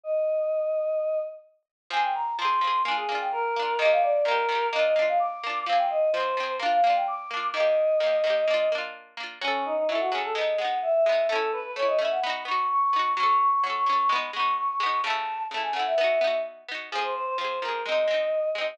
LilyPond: <<
  \new Staff \with { instrumentName = "Choir Aahs" } { \time 4/4 \key f \dorian \tempo 4 = 128 ees''2. r4 | aes''16 g''16 bes''8 c'''4 aes''16 aes'8 g''16 bes'4 | ees''16 f''16 d''8 bes'4 ees''16 ees''8 f''16 d'''4 | f''16 g''16 ees''8 c''4 f''16 f''8 g''16 d'''4 |
ees''2. r4 | \key fis \dorian cis'8 dis'16 dis'16 e'16 fis'16 gis'16 a'16 dis''8 fis''8 e''16 e''8. | a'8 b'16 b'16 cis''16 dis''16 e''16 fis''16 b''8 cis'''8 cis'''16 cis'''8. | cis'''8 cis'''16 cis'''16 cis'''16 cis'''16 cis'''16 cis'''16 b''8 cis'''8 cis'''16 cis'''8. |
a''4 a''16 gis''16 fis''16 e''4~ e''16 r4 | \key f \dorian aes'16 c''16 c''16 c''16 c''8 bes'8 ees''4. ees''16 ees''16 | }
  \new Staff \with { instrumentName = "Pizzicato Strings" } { \time 4/4 \key f \dorian r1 | <f c' aes'>4 <f c' aes'>8 <f c' aes'>8 <bes d' f'>8 <bes d' f'>4 <bes d' f'>8 | <ees bes g'>4 <ees bes g'>8 <ees bes g'>8 <bes d' f'>8 <bes d' f'>4 <bes d' f'>8 | <f c' aes'>4 <f c' aes'>8 <f c' aes'>8 <bes d' f'>8 <bes d' f'>4 <bes d' f'>8 |
<ees bes g'>4 <ees bes g'>8 <ees bes g'>8 <bes d' f'>8 <bes d' f'>4 <bes d' f'>8 | \key fis \dorian <fis cis' a'>4 <fis cis' a'>8 <fis cis' a'>8 <gis b dis'>8 <gis b dis'>4 <gis b dis'>8 | <a cis' e'>4 <a cis' e'>8 <a cis' e'>8 <b dis' fis'>8 <b dis' fis'>4 <b dis' fis'>8 | <fis cis' a'>4 <fis cis' a'>8 <fis cis' a'>8 <gis b dis'>8 <gis b dis'>4 <gis b dis'>8 |
<cis a e'>4 <cis a e'>8 <cis a e'>8 <b dis' fis'>8 <b dis' fis'>4 <b dis' fis'>8 | \key f \dorian <f c' aes'>4 <f c' aes'>8 <f c' aes'>8 <aes c' ees'>8 <aes c' ees'>4 <aes c' ees'>8 | }
>>